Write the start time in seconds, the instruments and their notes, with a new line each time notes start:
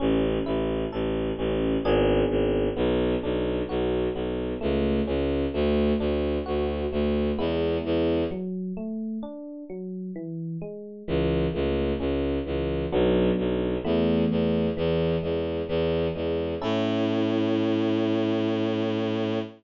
0.00 violin A1, electric piano 1 C#4
0.46 violin A1, electric piano 1 E4
0.92 violin A1, electric piano 1 A4
1.38 violin A1, electric piano 1 C#4
1.84 violin G#1, electric piano 1 B3 D4 G#4
2.30 violin G#1
2.76 violin B1, electric piano 1 B3
3.23 violin B1, electric piano 1 D4
3.69 violin B1, electric piano 1 F#4
4.15 violin B1, electric piano 1 B3
4.61 violin C#2, electric piano 1 A3
5.07 violin C#2, electric piano 1 C#4
5.54 violin D2, electric piano 1 A3
5.99 violin D2, electric piano 1 D4
6.46 violin D2, electric piano 1 F#4
6.92 violin D2, electric piano 1 A3
7.38 violin E2, electric piano 1 G#3 B3 E4
7.85 violin E2
8.31 electric piano 1 F#3
8.77 electric piano 1 A3
9.23 electric piano 1 D4
9.70 electric piano 1 F#3
10.16 electric piano 1 E3
10.62 electric piano 1 G#3
11.08 violin C#2, electric piano 1 E3
11.54 violin C#2, electric piano 1 A3
12.00 violin C#2, electric piano 1 C#4
12.46 violin C#2, electric piano 1 E3
12.92 violin B1, electric piano 1 F#3 B3 D4
13.38 violin B1
13.84 violin E2, electric piano 1 E3 A3 B3
14.31 violin E2
14.77 violin E2, electric piano 1 E3
15.23 violin E2, electric piano 1 G#3
15.68 violin E2, electric piano 1 E3
16.15 violin E2, electric piano 1 G#3
16.62 violin A2, electric piano 1 C#4 E4 A4